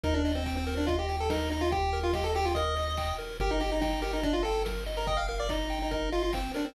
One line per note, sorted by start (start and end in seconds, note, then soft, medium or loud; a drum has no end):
0.04 3.13 D#2 loud
0.04 0.14 D#4 loud
0.04 0.22 A#4 loud
0.04 kick loud
0.04 closed hi-hat loud
0.14 0.32 D4 medium
0.25 0.44 D#5 medium
0.25 open hi-hat loud
0.35 0.55 C4 medium
0.46 0.65 G5 loud
0.46 kick loud
0.46 clap loud
0.57 0.75 C4 medium
0.67 0.86 A#4 loud
0.67 open hi-hat loud
0.77 0.87 D4 medium
0.87 0.97 F4 medium
0.87 1.06 D#5 medium
0.87 kick loud
0.87 closed hi-hat loud
0.99 1.16 G4 medium
1.09 1.28 G5 medium
1.09 open hi-hat medium
1.20 1.30 A4 medium
1.30 1.50 D#4 medium
1.30 1.49 A#4 medium
1.30 kick loud
1.30 snare loud
1.50 1.61 D#4 medium
1.50 1.69 D#5 loud
1.50 open hi-hat medium
1.61 1.71 F4 medium
1.71 2.00 G4 medium
1.71 1.90 G5 loud
1.71 kick loud
1.71 closed hi-hat loud
1.93 2.12 A#4 medium
1.93 open hi-hat medium
2.03 2.13 F4 medium
2.13 2.25 G4 medium
2.13 2.32 D#5 medium
2.13 kick loud
2.13 snare loud
2.24 2.34 A4 medium
2.35 2.46 G4 loud
2.35 2.54 G5 medium
2.35 open hi-hat loud
2.45 2.55 F4 medium
2.55 2.75 A#4 loud
2.55 3.14 D#5 medium
2.55 kick loud
2.55 closed hi-hat loud
2.76 2.95 D#5 medium
2.76 open hi-hat loud
2.97 3.17 G5 medium
2.97 kick loud
2.97 clap loud
3.18 3.37 A#4 medium
3.18 open hi-hat loud
3.40 6.48 G1 loud
3.40 3.51 G4 loud
3.40 3.59 A#4 loud
3.40 kick loud
3.40 closed hi-hat loud
3.51 3.61 D#4 medium
3.60 3.70 G4 medium
3.60 3.79 D#5 loud
3.60 open hi-hat loud
3.72 3.81 D#4 medium
3.81 4.01 D#4 medium
3.81 4.00 G5 medium
3.81 kick loud
3.81 snare loud
4.02 4.12 G4 medium
4.02 4.21 A#4 medium
4.02 open hi-hat loud
4.13 4.23 D#4 medium
4.23 4.33 D4 medium
4.23 4.42 D#5 loud
4.23 kick loud
4.23 closed hi-hat loud
4.33 4.43 F4 medium
4.43 4.63 A4 medium
4.43 4.64 G5 medium
4.43 open hi-hat loud
4.65 4.84 A#4 medium
4.65 kick medium
4.65 snare loud
4.86 5.05 D#5 medium
4.86 open hi-hat loud
4.97 5.07 A#4 medium
5.07 5.17 D#5 medium
5.07 5.26 G5 medium
5.07 kick loud
5.07 closed hi-hat loud
5.17 5.27 F5 medium
5.28 5.48 A#4 loud
5.28 5.38 F5 medium
5.28 open hi-hat medium
5.40 5.50 D5 medium
5.49 5.79 D#4 medium
5.49 5.68 D#5 medium
5.49 kick loud
5.49 clap loud
5.70 5.89 G5 loud
5.70 open hi-hat loud
5.82 5.91 D#4 medium
5.91 6.09 D#4 medium
5.91 6.10 A#4 medium
5.91 kick loud
5.91 closed hi-hat loud
6.12 6.22 F4 medium
6.12 6.31 D#5 medium
6.12 open hi-hat medium
6.23 6.33 F4 medium
6.33 6.52 C4 medium
6.33 6.52 G5 medium
6.33 kick loud
6.33 clap loud
6.54 6.66 D4 medium
6.54 6.73 A#4 medium
6.54 open hi-hat loud
6.65 6.74 C4 medium